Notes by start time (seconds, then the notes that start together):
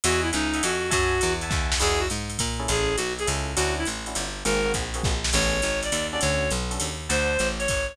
0.04 E2 F#4 D#5 E5 F#5 G#5, ride
0.22 E4
0.33 C#2 D#4 D#5 E5 F#5 G#5, hi-hat pedal, ride
0.53 D#5 E5 F#5 G#5, ride
0.63 F2 F#4, ride
0.91 F#2 F#4 E5 F#5 G#5 A5, kick, ride
1.21 E2, hi-hat pedal, ride
1.41 E5 F#5 G#5 A5, ride
1.50 D#2 E5 F#5 G#5 A5, kick, snare
1.72 snare
1.80 E2 D#4 E4 F#4 G#4, crash, ride
1.99 F#4
2.10 G#2, hi-hat pedal, ride
2.30 ride
2.38 A#2, kick, ride
2.60 C#4 E4 G#4 A4
2.68 A1 G#4, ride
2.97 B1 F#4, hi-hat pedal, ride
3.19 G#4, ride
3.27 C#2 C#4 E4 G#4 A4, ride
3.56 D2 C#4 D4 E4 F#4, ride
3.78 E4
3.85 A1, hi-hat pedal, ride
4.06 C#4 D4 E4 F#4, ride
4.15 G1, ride
4.45 G#1 A#3 C4 F#4 G#4 A#4, ride
4.66 A#3 C4 F#4 G#4
4.74 A#1, kick, hi-hat pedal, ride
4.94 A#3 C4 F#4 G#4, ride
5.03 A#1, kick, snare
5.24 snare
5.33 A1 B3 C#4 G#4 A4 C#5, crash, ride
5.62 G#1, hi-hat pedal, ride
5.83 D5, ride
5.92 D#2, ride
6.12 C#4 D4 F#4 A4 D5
6.21 D2 C#5, ride
6.50 B1, hi-hat pedal, ride
6.71 C#4 D4 F#4 A4, ride
6.80 D#2, ride
7.09 D2 C5 D5 F#5 A5, ride
7.39 A1, hi-hat pedal, ride
7.59 C#5, ride
7.68 G#1, kick, ride
7.88 C#5